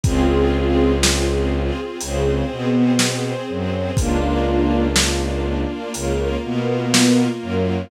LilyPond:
<<
  \new Staff \with { instrumentName = "String Ensemble 1" } { \time 4/4 \key des \major \tempo 4 = 61 <c' f' aes'>4 r4 des8 b4 ges8 | <bes d' f'>4 r4 des8 b4 ges8 | }
  \new Staff \with { instrumentName = "String Ensemble 1" } { \time 4/4 \key des \major <c' f' aes'>2 <c' aes' c''>2 | <bes d' f'>2 <bes f' bes'>2 | }
  \new Staff \with { instrumentName = "Violin" } { \clef bass \time 4/4 \key des \major des,2 des,8 b,4 ges,8 | des,2 des,8 b,4 ges,8 | }
  \new DrumStaff \with { instrumentName = "Drums" } \drummode { \time 4/4 <hh bd>4 sn4 hh4 sn4 | <hh bd>4 sn4 hh4 sn4 | }
>>